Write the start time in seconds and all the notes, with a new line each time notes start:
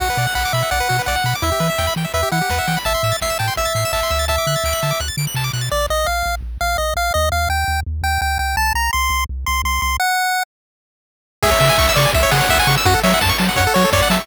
0.00 B1 F#4 F#5, kick, crash
0.10 B4
0.17 B2 D5, open hi-hat
0.27 F#5
0.35 B1 F#5 B5, kick, clap
0.45 D6
0.53 B2 E5 B5, open hi-hat
0.63 F#5
0.71 B1 D5 F#5, kick, closed hi-hat
0.80 B4
0.89 B2 F#4, open hi-hat
0.99 B4
1.06 B1 D5 F#5, kick, snare
1.16 F#5
1.24 B2 B5, open hi-hat
1.35 D6
1.42 E2 E4 E5, kick, closed hi-hat
1.52 G4
1.60 E3 B4, open hi-hat
1.70 E5
1.78 E2 G5, kick, snare
1.87 B5
1.96 E3 G5, open hi-hat
2.04 E5
2.14 E2 B4 E5, kick, closed hi-hat
2.23 G4
2.31 E3 E4 F#5, open hi-hat
2.41 G4
2.49 E2 B4, kick, snare
2.59 E5
2.67 E3 G5, open hi-hat
2.77 B5
2.85 A1 E5 A5, kick, closed hi-hat
2.94 C6
3.03 A2 E6, open hi-hat
3.12 A6
3.21 A1 E5 C7, kick, snare
3.30 E7
3.39 A2 G5 A5, open hi-hat
3.48 C6
3.56 A1 E5 E6, kick, closed hi-hat
3.65 A6
3.75 A2 C7, open hi-hat
3.85 E7
3.93 A1 E5 A5, kick, clap
4.03 C6
4.10 D2 E6, open hi-hat
4.19 A6
4.28 E5 A5, kick, closed hi-hat
4.38 D6
4.47 D3 F#6, open hi-hat
4.56 A6
4.64 D2 D7, kick, clap
4.73 F#7
4.83 D3 A5, open hi-hat
4.91 D6
4.99 D2 F#6, kick, closed hi-hat
5.08 A6
5.17 D3 D7, open hi-hat
5.27 F#7
5.34 C3 A5, kick, clap
5.44 D6
5.53 B2 F#6, open hi-hat
5.61 A6
5.72 A#1 D5
5.90 A#1 D#5
6.06 A#1 F5
6.26 A#1
6.42 A#1
6.61 A#1 F5
6.78 A#1 D#5
6.96 A#1 F5
7.14 D#2 D#5
7.32 D#2 F5
7.49 D#2 G5
7.68 D#2
7.86 D#2
8.03 D#2 G5
8.21 D2 G5
8.39 C#2 G5
8.57 C2 A5
8.74 C2 A#5
8.93 C2 C6
9.10 C2
9.29 C2
9.46 C2 C6
9.64 C2 C6
9.82 C2 C6
10.00 F#5
11.42 C#2 G#4 E5, kick, crash
11.51 C#5
11.60 C#3 E5, open hi-hat
11.69 G#5
11.78 C#2 C#6, kick, clap
11.89 E6
11.96 C#3 D5 C#6, open hi-hat
12.05 G#5
12.14 C#2 E5, kick, closed hi-hat
12.23 C#5
12.31 C#3 G#4 F#5, open hi-hat
12.41 C#5
12.49 C#2 E5, kick, snare
12.59 G#5
12.67 C#3 C#6, open hi-hat
12.77 E6
12.85 F#2 F#4 F#5, kick, closed hi-hat
12.94 A4
13.03 F#3 C#5 E5, open hi-hat
13.14 F#5
13.21 F#2 A5, kick, snare
13.29 C#6
13.38 F#3 A5, open hi-hat
13.48 F#5
13.56 F#2 C#5 F#5, kick, closed hi-hat
13.67 A4
13.74 F#3 F#4 C#5, open hi-hat
13.84 A4
13.92 F#2 C#5 D5, kick, snare
14.02 F#5
14.10 F#3 E5 A5, open hi-hat
14.20 C#6